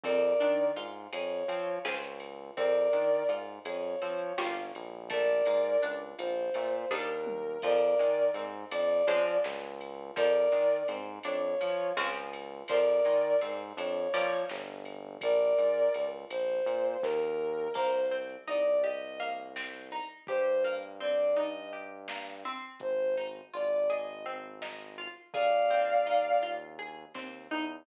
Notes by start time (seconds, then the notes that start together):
0.03 F2 C4 A#4 D5, kick, ride
0.40 D#3 D4, ride
0.76 G#2 F4, ride
1.13 F2 G#4 C#5, ride
1.48 F3 C4, ride
1.85 C#2 C4 C#4 F4 G#4, snare
2.20 ride
2.56 F2 C4 A#4 D5, kick, ride
2.93 D#3 D4, ride
3.28 G#2 F4, ride
3.65 F2 G#4 C#5, ride
4.02 F3 C4, ride
4.37 G1 A#3 C#4 F4 G4, snare
4.75 A#1, ride
5.10 A3 A#4 D5, kick, ride
5.45 G#2 A#3, ride
5.82 C#2 D4, ride
6.19 A#1 F4 C5, ride
6.54 A#2 A3, ride
6.90 D#2 G3 A#3 D4 D#4 A#4, kick, floor tom
7.27 high tom
7.62 F2 F3 A#4 D5, kick, crash
7.99 D#3 G#3, ride
8.34 G#2 C4, ride
8.71 F2 D4 D5, ride
9.07 F3 G#3 C4 C#4, ride
9.44 C#2, snare
9.81 ride
10.16 F2 F3 A#4 D5, kick, ride
10.52 D#3 G#3, ride
10.88 G#2 C4, ride
11.23 F2 D4 C#5, ride
11.61 F3, ride
11.97 C#2 F3 G#3 C4 C#4, snare
12.33 ride
12.68 F2 F3 A#4 D5, kick, ride
13.05 D#3 G#3, ride
13.41 G#2 C4, ride
13.77 F2 D4 C#5, ride
14.14 F3 G3 A#3 C#4, ride
14.49 G1, snare
14.85 ride
15.21 A#1 A#4 D5, kick, ride
15.58 G#2, ride
15.94 C#2, ride
16.30 A#1 C5, ride
16.66 A#2, ride
17.02 D#2 A#4, kick, snare
17.74 C2 A#3 C5, kick, crash
18.11 C4
18.30 closed hi-hat
18.47 C2 D#4 D5
18.83 G4 D#5, closed hi-hat
19.20 A#3
19.56 C4, snare
19.92 D#4
20.27 G2 G4 C5, kick, closed hi-hat
20.64 A#3
20.82 closed hi-hat
21.00 C4 D5
21.36 D#4 D#5, closed hi-hat
21.73 G4
22.08 A#3, snare
22.45 C4
22.80 G#1 C5, kick, closed hi-hat
23.17 D#4
23.36 closed hi-hat
23.53 G#1 F4 D5
23.90 G#4 D#5, closed hi-hat
24.26 C4
24.62 D#4, snare
24.98 F4
25.33 D#2 G#4 D5 F5, kick, closed hi-hat
25.70 C4
25.88 closed hi-hat
26.06 D#4
26.42 F4, closed hi-hat
26.79 G#4
27.14 D#2 C4, kick, snare
27.51 E2 D#4